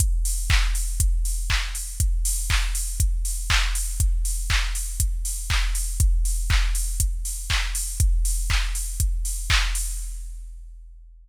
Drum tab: HH |xo-oxo-o|xo-oxo-o|xo-oxo-o|xo-oxo-o|
CP |--x---x-|--x---x-|--x---x-|--x---x-|
BD |o-o-o-o-|o-o-o-o-|o-o-o-o-|o-o-o-o-|

HH |xo-oxo-o|
CP |--x---x-|
BD |o-o-o-o-|